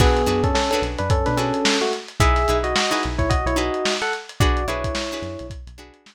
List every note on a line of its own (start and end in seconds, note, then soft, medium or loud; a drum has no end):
0.00 0.25 B1 loud
0.00 0.42 B3 medium
0.00 0.22 D4 loud
0.00 0.22 F#4 loud
0.00 0.22 G#4 loud
0.00 0.42 G#4 medium
0.00 0.22 B4 medium
0.00 kick medium
0.00 crash medium
0.17 closed hi-hat medium
0.26 0.52 F#2 medium
0.26 0.60 D4 medium
0.26 0.60 F#4 medium
0.26 0.60 G#4 medium
0.26 0.60 B4 medium
0.26 closed hi-hat medium
0.43 0.54 C#4 medium
0.43 0.54 A4 medium
0.43 kick medium
0.43 closed hi-hat medium
0.55 0.70 C#4 medium
0.55 0.70 A4 medium
0.55 snare medium
0.71 0.82 C#4 medium
0.71 1.15 D4 medium
0.71 1.15 F#4 medium
0.71 1.15 G#4 medium
0.71 0.82 A4 medium
0.71 1.15 B4 medium
0.71 closed hi-hat medium
0.82 0.96 B1 medium
0.82 closed hi-hat medium
0.99 1.24 F#2 medium
0.99 1.09 D4 medium
0.99 1.09 B4 medium
0.99 closed hi-hat medium
1.10 1.26 C#4 medium
1.10 1.26 A4 medium
1.10 kick medium
1.10 closed hi-hat medium
1.26 1.52 B2 medium
1.26 1.37 D4 medium
1.26 1.37 B4 medium
1.26 snare soft
1.26 closed hi-hat medium
1.37 1.78 C#4 medium
1.37 1.83 D4 medium
1.37 1.83 F#4 medium
1.37 1.83 G#4 medium
1.37 1.78 A4 medium
1.37 1.83 B4 medium
1.37 snare soft
1.37 closed hi-hat medium
1.54 closed hi-hat medium
1.65 snare loud
1.81 1.92 A3 medium
1.81 1.92 F#4 medium
1.81 closed hi-hat medium
1.93 closed hi-hat medium
2.08 closed hi-hat medium
2.20 2.46 B1 medium
2.20 2.43 D#4 loud
2.20 2.43 E4 loud
2.20 2.57 G#4 medium
2.20 2.43 G#4 medium
2.20 2.43 B4 medium
2.20 2.57 E5 loud
2.20 kick medium
2.20 closed hi-hat medium
2.36 snare soft
2.36 closed hi-hat medium
2.48 2.74 B1 medium
2.48 2.82 D#4 medium
2.48 2.82 E4 medium
2.48 2.82 G#4 medium
2.48 2.82 B4 medium
2.48 closed hi-hat medium
2.64 2.74 F#4 medium
2.64 2.74 D#5 medium
2.64 closed hi-hat medium
2.76 2.91 F#4 medium
2.76 2.91 D#5 medium
2.76 snare loud
2.91 3.33 D#4 medium
2.91 3.33 E4 medium
2.91 3.02 F#4 medium
2.91 3.33 G#4 medium
2.91 3.33 B4 medium
2.91 3.02 D#5 medium
2.91 closed hi-hat medium
3.03 3.18 B1 medium
3.03 snare soft
3.03 closed hi-hat medium
3.18 3.43 B1 medium
3.18 3.29 E4 medium
3.18 3.29 C#5 medium
3.18 kick medium
3.18 closed hi-hat medium
3.30 3.45 F#4 medium
3.30 3.45 D#5 medium
3.30 kick medium
3.30 closed hi-hat medium
3.45 3.70 B1 medium
3.45 3.57 E4 medium
3.45 3.57 C#5 medium
3.45 closed hi-hat medium
3.56 4.02 D#4 medium
3.56 4.02 E4 medium
3.56 3.93 F#4 medium
3.56 4.02 G#4 medium
3.56 4.02 B4 medium
3.56 3.93 D#5 medium
3.56 closed hi-hat medium
3.74 closed hi-hat medium
3.85 snare medium
4.02 4.13 A4 medium
4.02 4.13 F#5 medium
4.02 closed hi-hat medium
4.13 closed hi-hat medium
4.29 closed hi-hat medium
4.40 4.66 B1 medium
4.40 4.63 D4 medium
4.40 4.65 F#4 medium
4.40 4.63 F#4 loud
4.40 4.63 G#4 medium
4.40 4.63 B4 loud
4.40 4.65 D5 medium
4.40 kick medium
4.40 closed hi-hat medium
4.57 closed hi-hat medium
4.67 4.92 B1 medium
4.67 5.02 D4 medium
4.67 5.46 E4 medium
4.67 5.02 F#4 medium
4.67 5.02 G#4 medium
4.67 5.02 B4 medium
4.67 5.46 C#5 medium
4.67 closed hi-hat medium
4.84 kick medium
4.84 closed hi-hat medium
4.95 snare medium
5.11 5.54 D4 medium
5.11 5.54 F#4 medium
5.11 5.54 G#4 medium
5.11 5.54 B4 medium
5.11 closed hi-hat medium
5.22 5.37 F#2 medium
5.22 snare soft
5.22 closed hi-hat medium
5.39 5.65 B1 medium
5.39 closed hi-hat medium
5.50 kick medium
5.50 closed hi-hat medium
5.67 5.91 B1 medium
5.67 closed hi-hat medium
5.78 6.15 D4 medium
5.78 6.15 F#4 medium
5.78 6.15 G#4 medium
5.78 6.15 B4 medium
5.78 closed hi-hat medium
5.94 closed hi-hat medium
6.06 snare medium